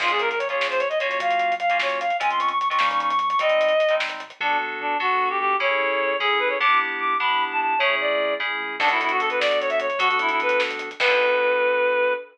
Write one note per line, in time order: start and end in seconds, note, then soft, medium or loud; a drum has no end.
0.00 0.55 A#1 loud
0.00 0.32 A#3 medium
0.00 0.32 C#4 medium
0.00 0.32 F4 medium
0.00 0.11 F4 medium
0.00 0.32 G#4 medium
0.00 kick loud
0.00 crash medium
0.08 0.21 G#4 medium
0.08 closed hi-hat medium
0.19 0.29 A#4 medium
0.19 closed hi-hat medium
0.29 0.39 A#4 medium
0.29 closed hi-hat medium
0.38 0.48 C#5 medium
0.38 closed hi-hat medium
0.49 0.82 A#3 medium
0.49 0.82 C#4 medium
0.49 0.82 F4 medium
0.49 0.82 G#4 medium
0.49 0.68 C#5 medium
0.49 closed hi-hat soft
0.60 1.15 A#1 medium
0.60 snare medium
0.70 0.79 C5 medium
0.70 closed hi-hat medium
0.79 0.89 C#5 medium
0.79 closed hi-hat medium
0.89 0.99 D#5 medium
0.89 closed hi-hat medium
0.99 1.53 A#3 medium
0.99 1.53 C#4 medium
0.99 1.53 F4 medium
0.99 1.53 F#4 medium
0.99 1.09 C#5 medium
0.99 closed hi-hat medium
1.09 1.19 C#5 medium
1.09 closed hi-hat medium
1.20 2.12 F#2 medium
1.20 1.55 F5 loud
1.20 kick medium
1.20 closed hi-hat medium
1.31 closed hi-hat medium
1.40 closed hi-hat medium
1.52 closed hi-hat medium
1.60 1.78 F5 loud
1.60 closed hi-hat medium
1.70 2.02 A#3 medium
1.70 2.02 C#4 medium
1.70 2.02 F4 medium
1.70 2.02 F#4 medium
1.70 closed hi-hat medium
1.80 1.99 C#5 medium
1.80 snare medium
1.90 closed hi-hat medium
2.00 2.17 F5 medium
2.00 closed hi-hat medium
2.10 closed hi-hat medium
2.20 2.76 C#2 medium
2.20 2.52 G#3 medium
2.20 2.52 C4 medium
2.20 2.52 C#4 medium
2.20 2.52 F4 medium
2.20 2.30 G#5 loud
2.20 kick medium
2.20 closed hi-hat medium
2.30 2.40 C6 medium
2.30 closed hi-hat medium
2.39 2.49 C#6 medium
2.39 closed hi-hat medium
2.49 2.58 C#6 medium
2.49 closed hi-hat medium
2.59 2.68 C#6 medium
2.59 closed hi-hat medium
2.69 2.78 G#3 medium
2.69 2.78 C4 medium
2.69 2.78 C#4 medium
2.69 2.78 F4 medium
2.69 2.88 C#6 medium
2.69 closed hi-hat medium
2.79 3.35 D#2 loud
2.79 3.12 G3 medium
2.79 3.12 A#3 medium
2.79 3.12 C#4 medium
2.79 3.12 D#4 loud
2.79 snare medium
2.91 3.00 C#6 medium
2.91 closed hi-hat medium
3.00 3.09 C#6 medium
3.00 closed hi-hat medium
3.09 3.19 C#6 medium
3.09 closed hi-hat medium
3.19 3.29 C#6 medium
3.19 closed hi-hat medium
3.30 3.39 C#6 medium
3.30 closed hi-hat medium
3.39 4.32 G#1 loud
3.39 3.72 G3 medium
3.39 3.72 G#3 medium
3.39 3.72 C4 medium
3.39 3.72 D#4 medium
3.39 3.95 D#5 loud
3.39 kick medium
3.39 closed hi-hat medium
3.49 closed hi-hat medium
3.61 closed hi-hat medium
3.69 closed hi-hat medium
3.80 closed hi-hat medium
3.89 4.22 G3 medium
3.89 4.22 G#3 medium
3.89 4.22 C4 medium
3.89 4.22 D#4 medium
3.89 closed hi-hat medium
4.00 snare medium
4.09 closed hi-hat medium
4.20 closed hi-hat medium
4.30 closed hi-hat medium
4.40 4.57 B1 loud
4.40 4.95 B3 loud
4.40 4.95 D4 loud
4.40 4.58 D4 medium
4.40 4.95 F#4 loud
4.40 4.95 A4 loud
4.60 4.77 B1 medium
4.80 4.97 B1 loud
4.80 4.97 D4 medium
5.00 5.33 B1 medium
5.00 5.54 B3 medium
5.00 5.54 D4 loud
5.00 5.54 F#4 loud
5.00 5.29 F#4 medium
5.00 5.54 A4 medium
5.30 5.39 G4 medium
5.39 5.57 B1 medium
5.39 5.56 G4 loud
5.60 5.77 A1 loud
5.60 6.14 C#4 loud
5.60 6.14 E4 loud
5.60 6.14 G#4 loud
5.60 6.14 A4 loud
5.60 6.17 C#5 loud
5.80 5.97 A1 medium
6.00 6.17 A1 medium
6.20 6.54 A1 medium
6.20 6.56 C#4 loud
6.20 6.56 E4 medium
6.20 6.56 G#4 loud
6.20 6.40 G#4 medium
6.20 6.56 A4 medium
6.39 6.49 B4 medium
6.49 6.58 C#5 medium
6.60 6.77 G1 loud
6.60 7.14 B3 loud
6.60 7.14 D4 medium
6.60 7.14 E4 loud
6.60 7.14 G4 loud
6.60 6.79 D6 loud
6.79 6.96 G1 medium
6.99 7.17 G1 medium
6.99 7.17 D6 medium
7.20 7.55 G1 medium
7.20 7.74 B3 medium
7.20 7.74 D4 loud
7.20 7.74 E4 medium
7.20 7.74 G4 medium
7.20 7.44 B5 medium
7.52 7.60 A5 medium
7.61 7.78 G1 medium
7.61 7.79 A5 medium
7.79 7.97 A1 loud
7.79 8.34 A3 loud
7.79 8.34 C#4 loud
7.79 8.34 E4 loud
7.79 8.34 G#4 loud
7.79 7.95 C#5 loud
8.00 8.17 A1 medium
8.00 8.34 D5 medium
8.20 8.37 A1 medium
8.40 8.58 A1 medium
8.40 8.76 A3 medium
8.40 8.76 C#4 loud
8.40 8.76 E4 medium
8.40 8.76 G#4 medium
8.60 8.78 A#1 medium
8.80 8.97 B1 loud
8.80 9.88 B3 loud
8.80 8.89 D4 loud
8.80 9.88 D4 loud
8.80 9.88 F#4 loud
8.80 9.88 A4 loud
8.80 kick loud
8.80 crash medium
8.89 9.00 E4 medium
8.89 closed hi-hat medium
9.00 9.17 B1 loud
9.00 9.11 E4 medium
9.00 closed hi-hat medium
9.09 9.20 F#4 medium
9.09 closed hi-hat medium
9.20 9.37 B1 medium
9.20 9.29 A4 medium
9.20 closed hi-hat medium
9.30 9.40 B4 medium
9.30 closed hi-hat medium
9.40 9.74 B1 medium
9.40 9.59 D5 medium
9.40 snare medium
9.51 closed hi-hat medium
9.61 9.70 C#5 medium
9.61 closed hi-hat medium
9.70 9.79 E5 loud
9.70 closed hi-hat medium
9.80 9.97 B1 medium
9.80 10.00 C#5 medium
9.80 closed hi-hat medium
9.90 closed hi-hat medium
9.99 10.17 D2 loud
9.99 10.89 B3 loud
9.99 10.89 D4 loud
9.99 10.08 F#4 loud
9.99 10.89 F#4 loud
9.99 10.89 A4 loud
9.99 kick medium
9.99 closed hi-hat medium
10.09 10.18 F#4 medium
10.09 closed hi-hat medium
10.19 10.37 D2 medium
10.19 10.30 E4 loud
10.19 closed hi-hat medium
10.29 10.40 E4 medium
10.29 closed hi-hat medium
10.40 10.57 D2 medium
10.40 10.61 B4 medium
10.40 closed hi-hat medium
10.49 closed hi-hat medium
10.60 10.95 D2 medium
10.60 snare medium
10.71 closed hi-hat medium
10.79 closed hi-hat medium
10.91 closed hi-hat medium
11.00 12.14 B1 medium
11.00 12.14 B3 medium
11.00 12.14 D4 medium
11.00 12.14 F#4 medium
11.00 12.14 A4 loud
11.00 12.14 B4 loud
11.00 kick loud
11.00 crash loud